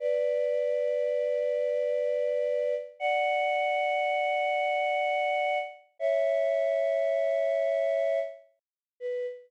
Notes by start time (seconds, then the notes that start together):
0.00 B4 D5
3.00 D5 F#5
5.99 C#5 E5
9.00 B4